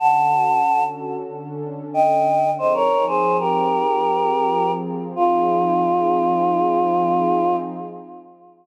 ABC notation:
X:1
M:4/4
L:1/16
Q:1/4=93
K:Fm
V:1 name="Choir Aahs"
[^f=a]6 z6 [eg]4 | [ce] [Bd]2 [Ac]2 [GB]9 z2 | F16 |]
V:2 name="Pad 2 (warm)"
[=D,^C^F=A]8 [D,C=DA]8 | [F,CEA]8 [F,CFA]8 | [F,CEA]16 |]